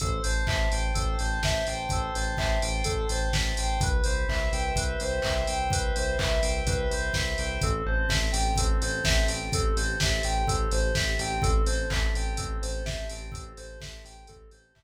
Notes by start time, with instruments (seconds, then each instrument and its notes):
0.00 synth bass 1 A1, electric piano 2 A4 C5, kick, closed hi-hat
0.23 synth bass 1 A1, electric piano 2 C5 A5, open hi-hat
0.47 synth bass 1 A1, electric piano 2 C5 E5, kick, clap
0.71 synth bass 1 A1, electric piano 2 G5, open hi-hat
0.94 synth bass 1 A1, electric piano 2 A4 C5, kick, closed hi-hat
1.19 synth bass 1 A1, electric piano 2 C5 A5, open hi-hat
1.43 synth bass 1 A1, electric piano 2 E5 G5, kick, snare
1.67 synth bass 1 A1, electric piano 2 C5 G5, open hi-hat
1.89 synth bass 1 A1, electric piano 2 A4 C5, kick, closed hi-hat
2.14 synth bass 1 A1, electric piano 2 C5 A5, open hi-hat
2.37 synth bass 1 A1, electric piano 2 C5 E5, kick, clap
2.62 synth bass 1 A1, electric piano 2 G5, open hi-hat
2.84 synth bass 1 A1, electric piano 2 A4 C5, kick, closed hi-hat
3.09 synth bass 1 A1, electric piano 2 C5 A5, open hi-hat
3.33 synth bass 1 A1, electric piano 2 E5 G5, kick, snare
3.57 synth bass 1 A1, electric piano 2 C5 G5, open hi-hat
3.81 synth bass 1 C2, electric piano 2 B4, kick, closed hi-hat
4.04 synth bass 1 C2, electric piano 2 C5, open hi-hat
4.28 synth bass 1 C2, electric piano 2 E5, kick, clap
4.52 synth bass 1 C2, electric piano 2 G5, open hi-hat
4.76 synth bass 1 C2, electric piano 2 B4, kick, closed hi-hat
5.00 synth bass 1 C2, electric piano 2 C5, open hi-hat
5.22 synth bass 1 C2, electric piano 2 E5, kick, clap
5.47 synth bass 1 C2, electric piano 2 G5, open hi-hat
5.70 synth bass 1 C2, electric piano 2 B4, kick, closed hi-hat
5.95 synth bass 1 C2, electric piano 2 C5, open hi-hat
6.19 synth bass 1 C2, electric piano 2 E5, kick, clap
6.42 synth bass 1 C2, electric piano 2 G5, open hi-hat
6.67 synth bass 1 C2, electric piano 2 B4, kick, closed hi-hat
6.90 synth bass 1 C2, electric piano 2 C5, open hi-hat
7.13 synth bass 1 C2, electric piano 2 E5, kick, snare
7.38 synth bass 1 C2, electric piano 2 G5, open hi-hat
7.61 synth bass 1 A1, electric piano 2 C4 A4, kick, closed hi-hat
7.86 synth bass 1 A1, electric piano 2 A4 C5
8.09 synth bass 1 A1, electric piano 2 C4 E5, kick, snare
8.32 synth bass 1 A1, electric piano 2 G4 G5, open hi-hat
8.56 synth bass 1 A1, electric piano 2 C4 A4, kick, closed hi-hat
8.81 synth bass 1 A1, electric piano 2 A4 C5, open hi-hat
9.04 synth bass 1 A1, electric piano 2 G4 E5, kick, snare
9.28 synth bass 1 A1, electric piano 2 C4 G5, open hi-hat
9.52 synth bass 1 A1, electric piano 2 C4 A4, kick, closed hi-hat
9.76 synth bass 1 A1, electric piano 2 A4 C5, open hi-hat
10.00 synth bass 1 A1, electric piano 2 C4 E5, kick, snare
10.23 synth bass 1 A1, electric piano 2 G4 G5, open hi-hat
10.47 synth bass 1 A1, electric piano 2 C4 A4, kick, closed hi-hat
10.71 synth bass 1 A1, electric piano 2 A4 C5, open hi-hat
10.95 synth bass 1 A1, electric piano 2 G4 E5, kick, snare
11.19 synth bass 1 A1, electric piano 2 C4 G5, open hi-hat
11.42 synth bass 1 A1, electric piano 2 C4 A4, kick, closed hi-hat
11.66 synth bass 1 A1, electric piano 2 A4 C5, open hi-hat
11.90 synth bass 1 A1, electric piano 2 C4 E5, kick, clap
12.14 synth bass 1 A1, electric piano 2 G4 G5, open hi-hat
12.37 synth bass 1 A1, electric piano 2 C4 A4, kick, closed hi-hat
12.62 synth bass 1 A1, electric piano 2 A4 C5, open hi-hat
12.85 synth bass 1 A1, electric piano 2 G4 E5, kick, snare
13.09 synth bass 1 A1, electric piano 2 C4 G5, open hi-hat
13.31 synth bass 1 A1, electric piano 2 C4 A4, kick, closed hi-hat
13.57 synth bass 1 A1, electric piano 2 A4 C5, open hi-hat
13.81 synth bass 1 A1, electric piano 2 C4 E5, kick, snare
14.05 synth bass 1 A1, electric piano 2 G4 G5, open hi-hat
14.27 synth bass 1 A1, electric piano 2 C4 A4, kick, closed hi-hat
14.51 synth bass 1 A1, electric piano 2 A4 C5, open hi-hat
14.75 synth bass 1 A1, electric piano 2 G4 E5, kick, clap